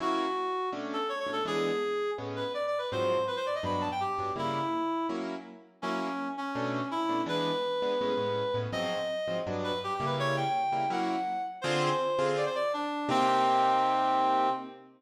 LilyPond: <<
  \new Staff \with { instrumentName = "Clarinet" } { \time 4/4 \key b \minor \tempo 4 = 165 fis'2 r8 a'8 \tuplet 3/2 { cis''8 cis''8 a'8 } | gis'2 r8 b'8 \tuplet 3/2 { d''8 d''8 b'8 } | c''4 b'16 c''16 d''16 ees''16 b''8 a''16 g''16 g'4 | e'2 r2 |
cis'4. cis'4. e'4 | b'1 | ees''2 r8 b'8 \tuplet 3/2 { g'8 g'8 b'8 } | cis''8 g''4. fis''4. r8 |
\key c \minor c''2 d''16 c''16 d''8 d'4 | c'1 | }
  \new Staff \with { instrumentName = "Acoustic Grand Piano" } { \time 4/4 \key b \minor <fis ais cis' e'>2 <b, a cis' d'>4. <b, a cis' d'>8 | <e gis b d'>2 <a, gis b cis'>2 | <aes, f ges c'>2 <g, fis b d'>4. <g, fis b d'>8 | <cis g bes e'>2 <fis ais cis' e'>2 |
<fis ais cis' e'>2 <b, a cis' d'>4. <b, a cis' d'>8 | <e gis b d'>4. <e gis b d'>8 <a, gis b cis'>8 <a, gis b cis'>4 <a, gis b cis'>8 | <aes, f ges c'>4. <aes, f ges c'>8 <g, fis b d'>4. <cis g bes e'>8~ | <cis g bes e'>4. <cis g bes e'>8 <fis ais cis' e'>2 |
\key c \minor <d c' f' aes'>4. <d c' f' aes'>2~ <d c' f' aes'>8 | <c bes ees' g'>1 | }
>>